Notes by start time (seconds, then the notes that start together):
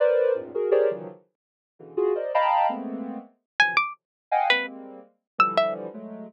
0.00 A#4 B4 C5 D5
0.34 E2 F#2 G#2 A2 A#2
0.54 F#4 G#4 A#4
0.71 G4 G#4 A#4 C5 C#5 D5
0.91 C#3 D#3 E3 F3 F#3
1.79 B2 C#3 D3 E3
1.97 F4 F#4 G#4
2.15 A#4 C5 D5 D#5
2.34 D#5 F5 G5 A5 A#5 B5
2.69 G#3 A3 A#3 B3 C4
3.60 B2 C3 D3 E3 F3 F#3 G#5
3.77 D6
4.31 D#5 F5 F#5 G5 G#5
4.50 G3 G#3 A#3 C4 B4
5.38 D3 E3 F3 G3 E6
5.57 E5
5.94 F#3 G#3 A3